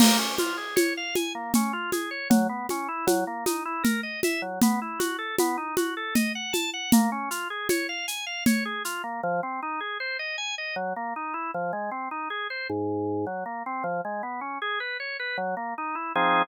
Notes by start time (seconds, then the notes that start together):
0.00 A#3, crash, low conga, shaker
0.19 C#4
0.38 F4, high conga, shaker
0.58 G#4
0.76 C#5, high conga, shaker
0.97 F5
1.15 G#5, high conga, shaker
1.35 A#3
1.54 C#4, low conga, shaker
1.73 F4
1.92 G#4, high conga, shaker
2.11 C#5
2.30 F#3, low conga, shaker
2.49 B3
2.69 C#4, high conga, shaker
2.88 E4
3.07 F#3, high conga, shaker
3.27 A#3
3.46 D#4, high conga, shaker
3.65 E4
3.83 A#4, low conga, shaker
4.03 D#5
4.23 E5, high conga, shaker
4.42 F#3
4.62 B3, low conga, shaker
4.82 E4
4.99 F#4, high conga, shaker
5.18 A4
5.38 B3, high conga, shaker
5.58 D#4
5.77 F#4, high conga, shaker
5.97 A4
6.15 D#5, low conga, shaker
6.35 F#5
6.53 A5, high conga, shaker
6.74 F#5
6.92 A#3, low conga, shaker
7.12 C#4
7.31 F4, shaker
7.50 G#4
7.69 C#5, high conga, shaker
7.89 F5
8.08 G#5, shaker
8.26 F5
8.46 C#5, low conga, shaker
8.65 G#4
8.85 F4, shaker
9.04 A#3
9.23 F3
9.43 C4
9.63 D#4
9.80 G#4
10.00 C5
10.19 D#5
10.38 G#5
10.58 D#5
10.76 F#3
10.96 A#3
11.16 D#4
11.34 E4
11.54 F3
11.73 G#3
11.91 C4
12.11 D#4
12.30 G#4
12.50 C5
12.70 G#2
13.27 F#3
13.46 A#3
13.66 C4
13.84 F3
14.05 G#3
14.23 B3
14.41 C#4
14.62 G#4
14.80 B4
15.00 C#5
15.20 B4
15.38 F#3
15.57 A#3
15.78 D#4
15.95 E4
16.15 F3 C4 D#4 G#4